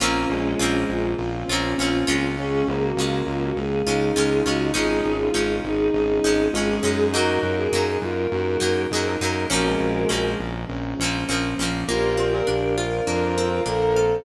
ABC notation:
X:1
M:4/4
L:1/16
Q:1/4=101
K:Bbm
V:1 name="Choir Aahs"
[DF]6 F6 F4 | A2 A G3 F G A6 G2 | [FA]6 A6 A4 | [GB]6 B6 B4 |
[GB]6 z10 | [K:Bb] [GB]6 B6 A4 |]
V:2 name="Violin"
B,2 A,6 z2 D6 | D2 B,6 z2 E6 | E3 F3 E2 E4 F A3 | G3 A3 F2 G4 A B3 |
D A,5 z10 | [K:Bb] F2 F B z4 F4 B2 z2 |]
V:3 name="Acoustic Grand Piano"
[B,CDF]4 [B,CDF]4 [B,CDF]4 [B,CDF]4 | [A,DF]4 [A,DF]4 [A,DF]4 [A,DF]4 | [A,DE]4 [A,DE]4 [A,DE]4 [A,DE]4 | [G,B,E]4 [G,B,E]4 [G,B,E]4 [G,B,E]4 |
[F,B,CD]4 [F,B,CD]4 [F,B,CD]4 [F,B,CD]4 | [K:Bb] B,2 C2 D2 F2 D2 C2 B,2 C2 |]
V:4 name="Pizzicato Strings"
[B,CDF]4 [B,CDF]6 [B,CDF]2 [B,CDF]2 [A,DF]2- | [A,DF]4 [A,DF]6 [A,DF]2 [A,DF]2 [A,DF]2 | [A,DE]4 [A,DE]6 [A,DE]2 [A,DE]2 [A,DE]2 | [G,B,E]4 [G,B,E]6 [G,B,E]2 [G,B,E]2 [G,B,E]2 |
[F,B,CD]4 [F,B,CD]6 [F,B,CD]2 [F,B,CD]2 [F,B,CD]2 | [K:Bb] B,2 C2 D2 F2 B,2 C2 D2 F2 |]
V:5 name="Synth Bass 1" clef=bass
B,,,2 B,,,2 B,,,2 B,,,2 B,,,2 B,,,2 B,,,2 D,,2- | D,,2 D,,2 D,,2 D,,2 D,,2 D,,2 D,,2 D,,2 | A,,,2 A,,,2 A,,,2 A,,,2 A,,,2 A,,,2 A,,,2 G,,2- | G,,2 G,,2 G,,2 G,,2 G,,2 G,,2 G,,2 G,,2 |
B,,,2 B,,,2 B,,,2 B,,,2 B,,,2 B,,,2 B,,,2 B,,,2 | [K:Bb] B,,,4 B,,,4 F,,4 B,,,4 |]
V:6 name="Pad 2 (warm)"
[B,CDF]16 | [A,DF]16 | [A,DE]16 | [G,B,E]16 |
[F,B,CD]8 [F,B,DF]8 | [K:Bb] [Bcdf]8 [Bcfb]8 |]